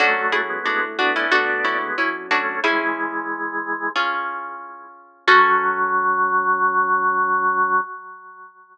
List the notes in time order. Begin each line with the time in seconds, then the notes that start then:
0.00 F#2 F#3 A3 C#4 D4 F#4 A4
0.32 E4 G#4
0.49 G#3 B3
0.66 A2 G#3 B3 D4 F#4
0.99 B3 D4 F#4
1.16 C#4 E4
1.32 D2 D4 F#4 A4
1.65 C#4 E4
1.82 G#3 B3
1.98 F#2 C#4 E4
2.31 A3 C#4 D4 F#4
2.64 E3 G#3 C#4 E4 G#4
3.96 C#4 F4 G#4
5.27 F#2 F#3 C#4 F#4 A4